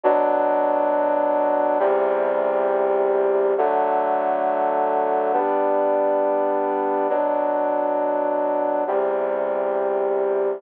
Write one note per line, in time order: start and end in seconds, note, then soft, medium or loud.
0.03 1.78 B2 medium
0.03 1.78 F#3 medium
0.03 1.78 D4 medium
1.79 3.54 E2 medium
1.79 3.54 C3 medium
1.79 3.54 G3 medium
3.58 5.32 D3 medium
3.58 5.32 F#3 medium
3.58 5.32 A3 medium
5.33 7.08 G3 medium
5.33 7.08 B3 medium
5.33 7.08 D4 medium
7.09 8.84 B2 medium
7.09 8.84 F#3 medium
7.09 8.84 D4 medium
8.87 10.62 E2 medium
8.87 10.62 C3 medium
8.87 10.62 G3 medium